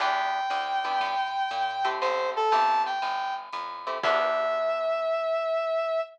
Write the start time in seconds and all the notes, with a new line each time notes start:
0.00 E2 B3 D4 E4 G4 G5, ride
0.50 D2, hi-hat pedal, ride
0.85 B3 D4 E4 G4, ride
1.00 G2, kick, ride
1.51 A#2, hi-hat pedal, ride
1.85 A3 C4 E4 G4, ride
2.01 A1 C5, ride
2.36 A4
2.51 G1 A3 C4 E4 G4 A5, kick, hi-hat pedal, ride
2.86 G5, ride
3.02 G1, ride
3.53 F2, hi-hat pedal, ride
3.87 A3 C4 E4 G4, ride
4.03 E2 B3 D4 E4 G4 E5, kick, crash